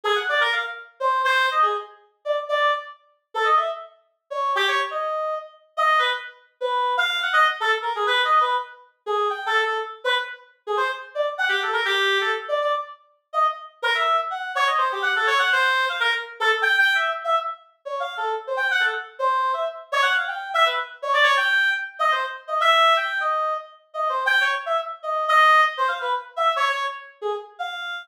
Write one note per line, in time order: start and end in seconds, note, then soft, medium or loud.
0.04 0.15 G#4 loud
0.15 0.26 F#5 medium
0.29 0.40 D5 medium
0.40 0.51 A#4 medium
0.52 0.63 F5 medium
1.00 1.22 C5 medium
1.24 1.46 C5 loud
1.51 1.62 D#5 medium
1.62 1.73 G#4 medium
2.25 2.36 D5 medium
2.49 2.71 D5 medium
3.34 3.45 A4 medium
3.45 3.56 D#5 medium
3.57 3.67 E5 medium
4.30 4.52 C#5 medium
4.55 4.66 G4 loud
4.68 4.79 C#5 medium
4.91 5.35 D#5 medium
5.77 5.99 D#5 medium
5.99 6.10 B4 medium
6.60 6.93 B4 medium
6.97 7.19 F5 loud
7.22 7.33 F#5 medium
7.33 7.44 D#5 loud
7.60 7.71 A4 medium
7.82 7.93 A#4 medium
7.95 8.06 G#4 medium
8.07 8.21 B4 medium
8.24 8.39 D#5 medium
8.40 8.55 B4 medium
9.06 9.28 G#4 medium
9.30 9.44 G5 medium
9.46 9.61 A4 medium
9.62 9.77 A4 medium
10.04 10.15 B4 medium
10.67 10.78 G#4 medium
10.77 10.88 C5 medium
11.15 11.26 D5 medium
11.38 11.49 F#5 medium
11.49 11.60 G4 medium
11.62 11.73 A4 medium
11.73 11.84 A#4 medium
11.85 12.18 G4 loud
12.21 12.32 A4 medium
12.48 12.59 D5 medium
12.61 12.72 D5 medium
13.33 13.44 D#5 medium
13.82 13.93 A#4 loud
13.95 14.16 E5 medium
14.30 14.52 F#5 medium
14.55 14.66 C#5 loud
14.67 14.78 D#5 medium
14.78 14.89 C5 medium
14.92 15.03 G4 medium
15.02 15.13 F#5 medium
15.16 15.27 A4 medium
15.27 15.38 C#5 loud
15.39 15.50 F#5 loud
15.52 15.85 C5 loud
15.89 16.00 F5 medium
16.00 16.11 A#4 loud
16.40 16.49 A4 loud
16.49 16.60 A4 medium
16.62 16.76 G5 loud
16.78 16.93 G5 loud
16.95 17.09 E5 medium
17.24 17.35 E5 medium
17.85 18.00 C#5 medium
18.00 18.14 F5 medium
18.17 18.32 A4 medium
18.47 18.58 C5 medium
18.57 18.67 G5 medium
18.71 18.82 F#5 loud
18.80 18.91 A4 medium
19.19 19.52 C5 medium
19.53 19.64 E5 medium
19.92 20.03 C#5 loud
20.02 20.13 F#5 loud
20.16 20.27 F5 soft
20.27 20.49 G5 medium
20.54 20.65 E5 loud
20.65 20.76 B4 medium
21.02 21.13 C#5 medium
21.13 21.24 D5 loud
21.23 21.34 C#5 loud
21.37 21.70 G5 loud
21.99 22.10 D#5 medium
22.11 22.22 C5 medium
22.47 22.58 D#5 medium
22.60 22.93 E5 loud
22.97 23.18 G5 medium
23.20 23.53 D#5 medium
23.94 24.08 D#5 medium
24.09 24.24 C5 medium
24.26 24.40 G5 loud
24.41 24.52 C#5 medium
24.66 24.77 E5 medium
25.03 25.25 D#5 medium
25.28 25.61 D#5 loud
25.77 25.88 C5 medium
25.88 25.99 F5 medium
26.01 26.12 B4 medium
26.36 26.51 E5 medium
26.56 26.68 C#5 loud
26.69 26.83 C#5 medium
27.21 27.32 G#4 medium
27.59 28.03 F5 medium